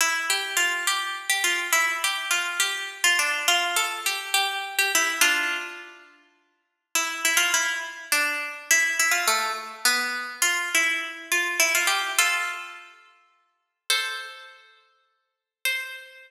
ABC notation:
X:1
M:6/8
L:1/16
Q:3/8=69
K:C
V:1 name="Pizzicato Strings"
E2 G2 F2 G3 G F2 | E2 G2 F2 G3 F D2 | F2 A2 G2 G3 G E2 | [DF]6 z6 |
E2 E F E2 z2 D4 | E2 E F A,2 z2 B,4 | F2 E4 F2 E F G2 | [FA]6 z6 |
[Ac]6 z6 | c12 |]